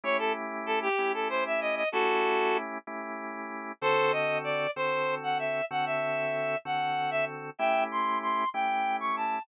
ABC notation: X:1
M:12/8
L:1/8
Q:3/8=127
K:A
V:1 name="Clarinet"
c A z2 A =G2 A =c e ^d d | [FA]5 z7 | [A=c]2 _e2 d2 c3 f =e2 | f e5 f3 e z2 |
[e=g]2 =c'2 c'2 g3 ^c' a2 |]
V:2 name="Drawbar Organ"
[A,CE=G]6 [A,CEG]6 | [A,CE=G]6 [A,CEG]6 | [D,=CFA]6 [D,CFA]6 | [D,=CFA]6 [D,CFA]6 |
[A,CE=G]6 [A,CEG]6 |]